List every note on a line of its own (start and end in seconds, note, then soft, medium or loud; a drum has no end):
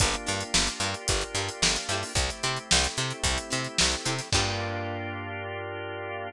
0.00 0.16 G1 loud
0.00 2.12 A#3 medium
0.00 0.10 D4 medium
0.00 2.12 D4 medium
0.00 2.12 F4 medium
0.00 0.10 F4 medium
0.00 2.12 G4 medium
0.00 0.10 G4 medium
0.00 0.10 A#4 medium
0.00 kick loud
0.00 closed hi-hat loud
0.14 closed hi-hat medium
0.26 0.43 G2 loud
0.26 0.45 D4 medium
0.26 0.45 F4 medium
0.26 0.45 G4 medium
0.26 0.45 A#4 medium
0.26 closed hi-hat medium
0.41 closed hi-hat medium
0.54 0.69 G1 loud
0.54 snare loud
0.67 closed hi-hat medium
0.80 0.95 G2 loud
0.80 1.00 D4 medium
0.80 1.00 F4 medium
0.80 1.00 G4 medium
0.80 closed hi-hat medium
0.84 1.00 A#4 medium
0.94 closed hi-hat medium
1.08 1.24 G1 loud
1.08 kick loud
1.08 closed hi-hat loud
1.21 closed hi-hat medium
1.35 1.49 G2 medium
1.35 1.54 D4 medium
1.35 1.54 F4 medium
1.35 1.54 G4 medium
1.35 1.54 A#4 medium
1.35 closed hi-hat medium
1.49 closed hi-hat medium
1.62 1.77 G1 medium
1.62 snare loud
1.76 closed hi-hat medium
1.89 2.04 G2 medium
1.89 2.27 C4 medium
1.89 2.27 E4 medium
1.89 2.27 G4 medium
1.89 closed hi-hat medium
1.93 2.27 A4 medium
2.03 open hi-hat medium
2.15 2.30 C2 loud
2.15 4.28 A3 medium
2.15 4.28 C4 medium
2.15 4.28 E4 medium
2.15 4.28 G4 medium
2.15 kick loud
2.15 closed hi-hat loud
2.29 snare soft
2.29 closed hi-hat medium
2.43 2.58 C3 loud
2.43 2.62 C4 medium
2.43 2.62 E4 medium
2.43 2.62 G4 medium
2.43 2.62 A4 medium
2.43 closed hi-hat medium
2.57 closed hi-hat medium
2.71 2.87 C2 loud
2.71 snare loud
2.84 closed hi-hat medium
2.97 3.13 C3 loud
2.97 3.17 C4 medium
2.97 3.17 E4 medium
2.97 3.17 G4 medium
2.97 3.17 A4 medium
2.97 closed hi-hat medium
3.10 closed hi-hat medium
3.24 3.38 C2 loud
3.24 kick medium
3.24 closed hi-hat loud
3.38 closed hi-hat medium
3.50 3.68 C3 loud
3.50 3.69 C4 medium
3.50 3.69 E4 medium
3.50 3.69 G4 medium
3.50 3.69 A4 medium
3.50 closed hi-hat medium
3.65 closed hi-hat medium
3.78 3.96 C2 loud
3.78 snare loud
3.92 closed hi-hat medium
4.05 4.21 C3 medium
4.05 4.15 C4 medium
4.05 4.15 E4 medium
4.05 4.15 G4 medium
4.05 4.15 A4 medium
4.05 closed hi-hat loud
4.19 snare soft
4.19 closed hi-hat medium
4.32 6.31 G2 loud
4.32 6.30 A#3 loud
4.32 6.30 D4 loud
4.32 6.30 F4 loud
4.32 6.30 G4 medium
4.32 6.30 A#4 loud
4.32 kick loud
4.32 crash loud